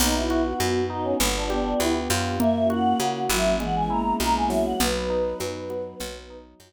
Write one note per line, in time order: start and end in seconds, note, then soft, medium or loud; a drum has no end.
0.00 0.54 B1 loud
0.00 0.60 B3 loud
0.00 0.82 B3 loud
0.00 1.19 B3 medium
0.00 0.14 D#4 loud
0.00 1.19 D#4 medium
0.00 1.19 F#4 medium
0.00 crash loud
0.00 low conga loud
0.14 0.42 E4 medium
0.30 1.16 F#4 loud
0.30 high conga medium
0.44 0.84 F#4 medium
0.60 1.14 F#2 medium
0.60 1.17 B3 medium
0.60 high conga medium
0.90 1.18 D#4 medium
0.90 1.15 D#4 loud
0.90 1.05 D#4 medium
1.04 1.18 C#4 medium
1.20 1.74 G1 loud
1.20 1.79 B3 loud
1.20 2.40 B3 medium
1.20 1.46 D4 loud
1.20 2.40 D4 medium
1.20 2.40 F4 medium
1.20 2.40 G4 medium
1.20 low conga medium
1.36 1.50 D4 loud
1.50 2.35 B3 medium
1.50 1.79 D4 medium
1.50 2.35 G4 medium
1.50 high conga medium
1.80 2.08 D2 medium
1.80 2.37 B3 medium
1.80 1.94 E4 medium
1.80 high conga medium
2.10 2.94 F#2 medium
2.10 2.39 F4 loud
2.10 snare medium
2.10 high conga medium
2.40 3.00 A#3 loud
2.40 3.24 A#3 loud
2.40 3.59 A#3 medium
2.40 3.59 C#4 medium
2.40 3.59 E4 medium
2.40 3.59 F#4 medium
2.40 2.67 E5 loud
2.40 low conga loud
2.70 3.55 F#4 loud
2.70 3.20 F#5 loud
2.70 high conga medium
3.00 3.28 C#3 medium
3.00 3.57 A#3 medium
3.00 high conga medium
3.29 4.13 G#1 medium
3.29 3.55 F#3 loud
3.29 3.58 E4 medium
3.29 3.58 E5 medium
3.29 high conga medium
3.60 3.88 E3 loud
3.60 4.79 G#3 medium
3.60 4.19 G#3 loud
3.60 4.79 B3 medium
3.60 4.79 C#4 medium
3.60 4.79 E4 medium
3.60 3.75 F#5 medium
3.60 low conga medium
3.75 3.90 G#5 loud
3.90 4.76 A#3 loud
3.90 4.75 E4 medium
3.90 4.14 A#5 medium
4.20 4.74 B1 medium
4.20 4.77 G#3 medium
4.20 4.34 A#5 loud
4.20 high conga medium
4.35 4.50 G#5 medium
4.50 5.39 F#3 loud
4.50 4.65 E5 medium
4.50 snare medium
4.65 4.79 F#5 loud
4.80 5.34 B1 medium
4.80 5.99 F#3 medium
4.80 5.99 B3 medium
4.80 5.99 D#4 medium
4.80 5.84 B4 loud
4.80 6.37 B4 medium
4.80 low conga loud
5.10 5.95 D#4 medium
5.40 5.94 F#2 medium
5.40 5.97 F#3 medium
5.40 high conga medium
5.70 5.99 B3 loud
5.70 high conga medium
6.00 6.54 B1 loud
6.00 6.59 F#3 loud
6.00 6.73 F#3 medium
6.00 6.73 B3 medium
6.00 6.73 D#4 medium
6.00 low conga medium
6.30 6.73 D#4 medium
6.60 6.73 F#2 medium
6.60 6.73 F#3 loud
6.60 high conga medium